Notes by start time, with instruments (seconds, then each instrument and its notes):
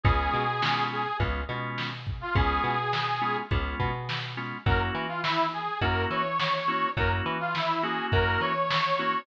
0.03 electric bass (finger) C#2, drawbar organ G#3 B3 C#4 F4, harmonica G#4, kick, closed hi-hat
0.33 electric bass (finger) B2, closed hi-hat
0.62 drawbar organ G#3 B3 C#4 F4, snare
0.91 harmonica G#4, closed hi-hat
1.20 electric bass (finger) C#2, drawbar organ G#3 B3 C#4 F4, kick, closed hi-hat
1.49 electric bass (finger) B2, drawbar organ G#3 B3 C#4 F4, closed hi-hat
1.78 snare
2.06 kick, closed hi-hat
2.21 harmonica F4
2.35 electric bass (finger) C#2, drawbar organ G#3 B3 C#4 F4, harmonica G#4, kick, closed hi-hat
2.64 electric bass (finger) B2, closed hi-hat
2.93 snare
3.22 drawbar organ G#3 B3 C#4 F4, closed hi-hat
3.51 electric bass (finger) C#2, drawbar organ G#3 B3 C#4 F4, kick, closed hi-hat
3.80 electric bass (finger) B2, kick, closed hi-hat
4.09 snare
4.37 drawbar organ G#3 B3 C#4 F4, closed hi-hat
4.66 electric bass (finger) F#2, drawbar organ A#3 C#4 E4 F#4, harmonica A#4, kick, closed hi-hat
4.95 electric bass (finger) E3, closed hi-hat
5.08 harmonica F4
5.23 harmonica E4, snare
5.53 harmonica G#4, closed hi-hat
5.81 electric bass (finger) F#2, drawbar organ A#3 C#4 E4 F#4, harmonica A#4, kick, closed hi-hat
6.10 electric bass (finger) E3, harmonica C#5, closed hi-hat
6.40 snare
6.68 drawbar organ A#3 C#4 E4 F#4, closed hi-hat
6.97 electric bass (finger) F#2, drawbar organ A#3 C#4 E4 F#4, harmonica A#4, kick, closed hi-hat
7.26 electric bass (finger) E3, closed hi-hat
7.40 harmonica F4
7.55 harmonica E4, snare
7.83 drawbar organ A#3 C#4 E4 F#4, harmonica G#4, closed hi-hat
8.12 electric bass (finger) F#2, harmonica A#4, kick, closed hi-hat
8.41 electric bass (finger) E3, harmonica C#5, closed hi-hat
8.70 snare
8.99 drawbar organ A#3 C#4 E4 F#4, closed hi-hat